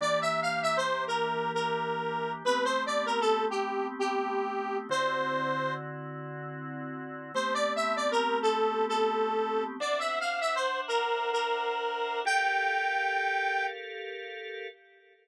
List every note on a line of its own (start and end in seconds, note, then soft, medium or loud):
0.01 2.43 E3 medium
0.01 2.43 A#3 medium
0.01 2.43 D4 medium
0.01 2.43 G4 medium
0.01 0.20 D5 medium
0.21 0.41 E5 medium
0.42 0.61 F5 medium
0.62 0.77 E5 medium
0.77 1.04 C5 medium
1.07 1.52 A#4 medium
1.54 2.32 A#4 medium
2.45 4.87 A3 medium
2.45 4.87 B3 medium
2.45 4.87 C4 medium
2.45 4.87 G4 medium
2.45 2.64 B4 medium
2.64 2.84 C5 medium
2.86 3.06 D5 medium
3.06 3.20 A#4 medium
3.21 3.45 A4 medium
3.50 3.87 G4 medium
3.99 4.77 G4 medium
4.89 7.32 D3 medium
4.89 7.32 C4 medium
4.89 7.32 E4 medium
4.89 7.32 F#4 medium
4.89 5.74 C5 medium
7.34 9.77 A3 medium
7.34 9.77 B3 medium
7.34 9.77 C4 medium
7.34 9.77 G4 medium
7.34 7.54 C5 medium
7.54 7.73 D5 medium
7.76 7.95 E5 medium
7.96 8.11 D5 medium
8.11 8.39 A#4 medium
8.42 8.85 A4 medium
8.89 9.64 A4 medium
9.80 12.22 D4 medium
9.80 12.22 C5 medium
9.80 10.00 D5 medium
9.80 12.22 E5 medium
9.80 12.22 F#5 medium
9.99 10.19 E5 medium
10.20 10.40 F5 medium
10.41 10.55 E5 medium
10.55 10.80 C5 medium
10.88 11.30 A#4 medium
11.33 12.20 A#4 medium
12.25 14.67 G4 medium
12.25 14.67 A4 medium
12.25 14.67 A#4 medium
12.25 14.67 F5 medium
12.25 13.66 G5 loud